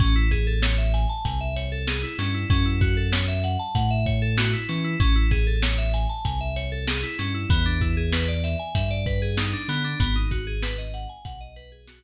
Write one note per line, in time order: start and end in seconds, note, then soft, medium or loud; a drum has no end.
0.00 1.06 A1 loud
0.00 0.14 C#4 medium
0.00 kick loud
0.00 closed hi-hat loud
0.16 0.30 E4 medium
0.31 0.45 G#4 medium
0.31 kick medium
0.31 closed hi-hat medium
0.47 0.61 A4 medium
0.62 0.77 C#5 medium
0.62 snare loud
0.78 0.92 E5 medium
0.94 1.08 G#5 medium
0.94 closed hi-hat medium
1.09 1.23 A5 medium
1.25 2.05 C2 medium
1.25 1.39 G#5 medium
1.25 kick medium
1.25 closed hi-hat loud
1.41 1.55 E5 medium
1.56 1.70 C#5 medium
1.56 closed hi-hat medium
1.72 1.86 A4 medium
1.88 2.02 G#4 medium
1.88 snare loud
2.03 2.17 E4 medium
2.18 2.45 G2 medium
2.18 2.33 C#4 medium
2.18 snare medium
2.18 closed hi-hat medium
2.34 2.48 E4 medium
2.50 3.57 F#2 medium
2.50 2.64 C#4 medium
2.50 kick loud
2.50 closed hi-hat loud
2.66 2.80 E4 medium
2.81 2.95 F#4 medium
2.81 kick medium
2.81 closed hi-hat medium
2.97 3.11 A4 medium
3.12 3.27 C#5 medium
3.12 snare loud
3.28 3.42 E5 medium
3.44 3.58 F#5 medium
3.44 closed hi-hat medium
3.59 3.73 A5 medium
3.75 4.55 A2 medium
3.75 3.89 F#5 medium
3.75 kick medium
3.75 closed hi-hat loud
3.91 4.05 E5 medium
4.06 4.20 C#5 medium
4.06 kick medium
4.06 closed hi-hat medium
4.22 4.36 A4 medium
4.38 4.52 F#4 medium
4.38 snare loud
4.53 4.67 E4 medium
4.69 4.95 E3 medium
4.69 4.83 C#4 medium
4.69 snare medium
4.69 closed hi-hat medium
4.84 4.98 E4 medium
5.00 6.07 A1 medium
5.00 5.14 C#4 loud
5.00 kick loud
5.00 closed hi-hat medium
5.16 5.30 E4 medium
5.31 5.45 G#4 medium
5.31 kick medium
5.31 closed hi-hat medium
5.47 5.61 A4 medium
5.62 5.77 C#5 medium
5.62 snare loud
5.78 5.92 E5 medium
5.94 6.08 G#5 medium
5.94 closed hi-hat medium
6.09 6.23 A5 medium
6.25 7.04 C2 medium
6.25 6.39 G#5 medium
6.25 kick medium
6.25 closed hi-hat medium
6.41 6.55 E5 medium
6.56 6.70 C#5 medium
6.56 closed hi-hat medium
6.72 6.86 A4 medium
6.88 7.02 G#4 medium
6.88 snare loud
7.03 7.17 E4 medium
7.19 7.46 G2 medium
7.19 7.33 C#4 medium
7.19 snare medium
7.19 closed hi-hat medium
7.34 7.48 E4 medium
7.49 8.56 E2 loud
7.49 7.64 B3 medium
7.49 kick loud
7.49 closed hi-hat loud
7.66 7.80 D4 medium
7.81 7.95 E4 medium
7.81 kick medium
7.81 closed hi-hat medium
7.97 8.11 G#4 medium
8.12 8.27 B4 medium
8.12 snare loud
8.28 8.42 D5 medium
8.44 8.58 E5 medium
8.44 closed hi-hat medium
8.59 8.73 G#5 medium
8.75 9.55 G2 medium
8.75 8.89 E5 medium
8.75 kick medium
8.75 closed hi-hat loud
8.91 9.05 D5 medium
9.06 9.20 B4 medium
9.06 kick medium
9.06 closed hi-hat medium
9.22 9.36 G#4 medium
9.37 9.52 D#4 medium
9.37 snare loud
9.53 9.67 D4 medium
9.68 9.95 D3 medium
9.68 9.83 B3 medium
9.68 snare medium
9.68 closed hi-hat medium
9.84 9.98 D4 medium
10.00 11.07 G#1 loud
10.00 10.14 B3 medium
10.00 kick medium
10.00 closed hi-hat loud
10.16 10.30 D#4 medium
10.31 10.45 F#4 medium
10.31 kick medium
10.31 closed hi-hat medium
10.47 10.61 G#4 medium
10.62 10.77 B4 medium
10.62 snare loud
10.78 10.92 D#5 medium
10.94 11.08 F#5 medium
10.94 closed hi-hat medium
11.09 11.23 G#5 medium
11.25 12.04 B1 medium
11.25 11.39 F#5 medium
11.25 kick medium
11.25 closed hi-hat loud
11.41 11.55 D#5 medium
11.56 11.70 B4 medium
11.56 closed hi-hat medium
11.72 11.86 G#4 medium
11.88 12.02 F#4 medium
11.88 snare loud